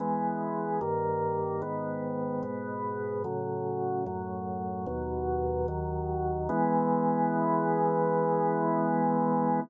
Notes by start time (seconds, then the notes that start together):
0.00 E3 G#3 B3
0.81 G2 D#3 A#3
1.62 G#2 D#3 B3
2.43 G#2 B2 B3
3.24 A2 C#3 F#3
4.06 F#2 A2 F#3
4.86 D#2 B2 F#3
5.68 D#2 D#3 F#3
6.49 E3 G#3 B3